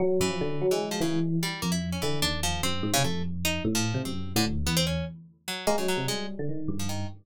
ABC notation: X:1
M:5/8
L:1/16
Q:1/4=148
K:none
V:1 name="Electric Piano 1" clef=bass
^F,2 ^F,, =F, D,2 ^F, ^G,3 | E,4 z2 F,,4 | D,2 ^D,,4 ^F,,2 ^G,, C, | F,,6 A,,3 C, |
^F,,3 A,, D,,2 E,,4 | z6 ^G, ^F,2 C, | G,3 D, ^D,2 G,,4 |]
V:2 name="Orchestral Harp"
z2 E,5 E,2 F, | ^C,2 z2 G,2 ^A, E2 ^C | E,2 D2 F,2 C3 ^C, | A,2 z2 ^D2 z F,3 |
C3 D, z2 B, C ^C2 | z4 ^F,2 ^A, ^C, F,2 | ^G,2 z5 F, ^D,2 |]